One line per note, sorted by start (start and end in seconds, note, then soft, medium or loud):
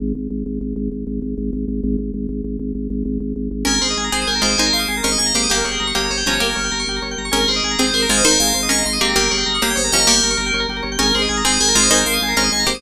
0.00 0.13 G#1 loud
0.15 0.28 G#1 medium
0.30 0.43 G#1 medium
0.46 0.59 G#1 medium
0.61 0.74 G#1 medium
0.76 0.89 G#1 medium
0.92 1.05 G#1 medium
1.07 1.20 G#1 medium
1.22 1.35 G#1 medium
1.37 1.50 G#1 medium
1.53 1.66 G#1 medium
1.68 1.81 G#1 medium
1.83 1.96 G#1 loud
1.98 2.11 G#1 medium
2.14 2.27 G#1 medium
2.29 2.42 G#1 medium
2.44 2.57 G#1 medium
2.59 2.72 G#1 medium
2.75 2.88 G#1 medium
2.90 3.03 G#1 medium
3.05 3.18 G#1 loud
3.20 3.33 G#1 medium
3.36 3.49 G#1 medium
3.51 3.64 G#1 medium
3.65 3.79 G#1 medium
3.65 4.02 C#4 medium
3.65 3.74 G#4 medium
3.65 4.02 A#4 medium
3.65 3.79 A#4 medium
3.74 3.81 A#4 medium
3.81 3.95 G#1 medium
3.81 4.09 G#4 medium
3.81 3.88 C5 medium
3.90 3.97 D#5 medium
3.97 4.10 G#1 medium
3.97 4.04 G#5 medium
4.04 4.11 A#5 medium
4.12 4.25 G#1 medium
4.12 4.38 C4 medium
4.12 4.38 G#4 medium
4.12 4.27 C5 medium
4.12 4.19 C6 medium
4.22 4.28 D#6 medium
4.27 4.40 G#1 medium
4.27 4.34 G#4 medium
4.27 4.42 A#4 medium
4.35 4.42 A#4 medium
4.42 4.56 G#1 medium
4.42 4.56 G#3 medium
4.42 4.56 F4 medium
4.42 4.57 C5 medium
4.42 4.51 C5 medium
4.51 4.58 D#5 medium
4.58 4.71 G#1 medium
4.58 5.03 D#4 medium
4.58 4.72 A#4 medium
4.58 5.03 C5 medium
4.58 4.65 G#5 medium
4.66 4.73 A#5 medium
4.73 4.86 G#1 medium
4.73 4.99 F5 medium
4.73 4.80 C6 medium
4.79 4.86 D#6 medium
4.88 5.02 G#1 medium
4.88 4.95 G#4 medium
4.97 5.04 A#4 medium
5.03 5.17 G#1 medium
5.03 5.32 C#4 medium
5.03 5.32 A#4 medium
5.03 5.10 C5 medium
5.03 5.16 D#5 medium
5.12 5.19 D#5 medium
5.18 5.32 G#1 medium
5.18 5.32 D#5 medium
5.18 5.25 G#5 medium
5.26 5.33 A#5 medium
5.34 5.47 G#1 medium
5.34 5.50 A#3 medium
5.34 5.50 G4 medium
5.34 5.49 C5 medium
5.34 5.42 C6 medium
5.43 5.50 D#6 medium
5.50 5.63 G1 medium
5.50 5.94 A#3 medium
5.50 5.57 G4 medium
5.50 5.94 G4 medium
5.50 5.64 A#4 medium
5.57 5.64 A#4 medium
5.64 5.78 G1 medium
5.64 5.91 G#4 medium
5.64 5.71 C#5 medium
5.71 5.78 G5 medium
5.80 5.93 G1 medium
5.80 5.87 A#5 medium
5.87 5.94 C#6 medium
5.95 6.09 G1 medium
5.95 6.20 A#3 medium
5.95 6.02 G4 medium
5.95 6.20 G4 medium
5.95 6.09 C#5 medium
6.04 6.11 A#4 medium
6.10 6.23 G1 medium
6.10 6.25 C5 medium
6.10 6.17 C#5 medium
6.17 6.24 G5 medium
6.26 6.39 G1 medium
6.26 6.40 F3 medium
6.26 6.40 C#4 medium
6.26 6.41 C#5 medium
6.26 6.33 A#5 medium
6.34 6.40 C#6 medium
6.40 6.54 G1 medium
6.40 6.82 A#3 medium
6.40 6.82 G4 medium
6.40 6.48 G4 medium
6.40 6.94 A#4 medium
6.49 6.56 A#4 medium
6.56 6.70 G1 medium
6.56 6.62 C#5 medium
6.64 6.71 G5 medium
6.72 6.85 G1 medium
6.72 6.78 A#5 medium
6.80 6.86 C#6 medium
6.87 7.00 G1 medium
6.87 6.96 G4 medium
6.96 7.03 A#4 medium
7.02 7.15 G1 medium
7.02 7.09 C#5 medium
7.11 7.18 G5 medium
7.18 7.31 G1 medium
7.18 7.25 A#5 medium
7.25 7.32 C#6 medium
7.31 7.46 G#1 medium
7.31 7.70 C#4 medium
7.31 7.38 G#4 loud
7.31 7.45 A#4 medium
7.31 7.70 A#4 medium
7.40 7.47 A#4 medium
7.48 7.61 G#1 medium
7.48 7.75 G#4 medium
7.48 7.55 C5 medium
7.56 7.63 D#5 medium
7.63 7.76 G#1 medium
7.63 7.71 G#5 medium
7.71 7.78 A#5 medium
7.79 7.92 G#1 medium
7.79 8.04 C4 medium
7.79 8.04 G#4 medium
7.79 7.93 C5 medium
7.79 7.86 C6 medium
7.87 7.93 D#6 medium
7.94 8.07 G#1 medium
7.94 8.08 A#4 medium
7.94 8.01 C6 medium
8.02 8.09 A#5 medium
8.09 8.22 G#1 medium
8.09 8.24 G#3 medium
8.09 8.24 F4 medium
8.09 8.23 C5 medium
8.09 8.16 G#5 medium
8.17 8.24 D#5 medium
8.24 8.37 G#1 medium
8.24 8.69 D#4 medium
8.24 8.38 A#4 medium
8.24 8.69 C5 loud
8.24 8.32 C5 medium
8.31 8.38 A#4 medium
8.40 8.53 G#1 medium
8.40 8.48 G#4 medium
8.40 8.65 F5 medium
8.48 8.54 A#4 medium
8.54 8.68 G#1 medium
8.54 8.61 C5 medium
8.63 8.69 D#5 medium
8.69 8.83 G#1 medium
8.69 8.84 C#4 medium
8.69 8.84 A#4 medium
8.69 8.83 D#5 medium
8.69 8.77 G#5 medium
8.78 8.85 A#5 medium
8.85 8.99 G#1 medium
8.85 8.98 D#5 medium
8.85 8.93 C6 medium
8.93 9.00 D#6 medium
9.01 9.14 G#1 medium
9.01 9.15 A#3 medium
9.01 9.15 C4 medium
9.01 9.15 G4 medium
9.01 9.08 C6 medium
9.09 9.16 A#5 medium
9.16 9.29 G1 medium
9.16 9.60 A#3 medium
9.16 9.60 G4 loud
9.16 9.23 G4 medium
9.16 9.30 A#4 medium
9.23 9.30 A#4 medium
9.31 9.44 G1 medium
9.31 9.57 G#4 medium
9.31 9.38 C#5 medium
9.38 9.44 G5 medium
9.46 9.59 G1 medium
9.46 9.53 A#5 medium
9.55 9.62 C#6 medium
9.62 9.75 G1 medium
9.62 9.87 A#3 medium
9.62 9.87 G4 medium
9.62 9.76 C#5 medium
9.62 9.69 A#5 medium
9.70 9.77 G5 medium
9.75 9.90 G1 medium
9.75 9.91 C5 medium
9.75 9.82 C#5 medium
9.84 9.91 A#4 medium
9.92 10.05 G1 medium
9.92 10.06 F3 medium
9.92 10.06 C#4 medium
9.92 9.99 G4 medium
9.92 10.07 D#5 medium
10.00 10.07 A#4 medium
10.07 10.21 G1 medium
10.07 10.49 A#3 medium
10.07 10.49 G4 medium
10.07 10.60 A#4 medium
10.07 10.14 C#5 medium
10.16 10.23 G5 medium
10.23 10.36 G1 medium
10.23 10.30 A#5 medium
10.30 10.37 C#6 medium
10.37 10.51 G1 medium
10.37 10.44 A#5 medium
10.46 10.53 G5 medium
10.53 10.66 G1 medium
10.53 10.61 C#5 medium
10.60 10.67 A#4 medium
10.69 10.82 G1 medium
10.69 10.76 G4 medium
10.77 10.84 A#4 medium
10.83 10.97 G1 medium
10.83 10.90 C#5 medium
10.92 10.99 G5 medium
10.99 11.12 G#1 medium
10.99 11.36 C#4 medium
10.99 11.07 G#4 loud
10.99 11.36 A#4 medium
10.99 11.12 A#4 medium
11.07 11.14 A#4 medium
11.15 11.28 G#1 medium
11.15 11.42 G#4 medium
11.15 11.22 C5 medium
11.22 11.29 D#5 medium
11.29 11.43 G#1 medium
11.29 11.36 G#5 medium
11.37 11.44 A#5 medium
11.44 11.58 G#1 medium
11.44 11.70 C4 medium
11.44 11.70 G#4 medium
11.44 11.60 C5 medium
11.44 11.51 C6 medium
11.52 11.59 D#6 medium
11.60 11.73 G#1 medium
11.60 11.67 G#4 medium
11.60 11.75 A#4 medium
11.68 11.75 A#4 medium
11.75 11.88 G#1 medium
11.75 11.90 G#3 medium
11.75 11.90 F4 medium
11.75 11.90 C5 medium
11.75 11.83 C5 medium
11.83 11.90 D#5 medium
11.91 12.04 G#1 medium
11.91 12.34 D#4 medium
11.91 12.05 A#4 medium
11.91 12.34 C5 loud
11.91 11.98 G#5 medium
11.98 12.05 A#5 medium
12.06 12.19 G#1 medium
12.06 12.31 F5 medium
12.06 12.14 C6 medium
12.14 12.20 D#6 medium
12.21 12.34 G#1 medium
12.21 12.30 G#4 medium
12.28 12.35 A#4 medium
12.37 12.50 G#1 medium
12.37 12.65 C#4 medium
12.37 12.65 A#4 medium
12.37 12.44 C5 medium
12.37 12.49 D#5 medium
12.44 12.51 D#5 medium
12.52 12.65 G#1 medium
12.52 12.65 D#5 medium
12.52 12.59 G#5 medium
12.60 12.66 A#5 medium
12.66 12.80 G#1 medium
12.66 12.81 A#3 medium
12.66 12.81 G4 medium
12.66 12.82 C5 medium
12.66 12.73 C6 medium
12.74 12.81 D#6 medium